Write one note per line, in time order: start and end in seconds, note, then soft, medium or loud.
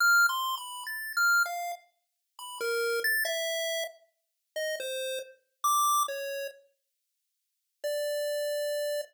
0.00 0.26 F6 loud
0.29 0.55 C6 medium
0.57 0.84 B5 medium
0.87 1.13 A6 medium
1.17 1.43 F6 medium
1.46 1.72 F5 medium
2.39 2.58 B5 medium
2.61 3.00 A#4 medium
3.04 3.24 A6 loud
3.25 3.84 E5 medium
4.56 4.76 D#5 medium
4.80 5.19 C5 medium
5.64 6.03 D6 loud
6.08 6.47 C#5 medium
7.84 9.01 D5 medium